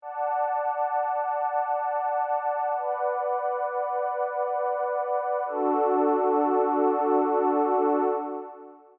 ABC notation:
X:1
M:3/4
L:1/8
Q:1/4=66
K:Dlyd
V:1 name="Pad 2 (warm)"
[dfa]6 | [Bdf]6 | [DFA]6 |]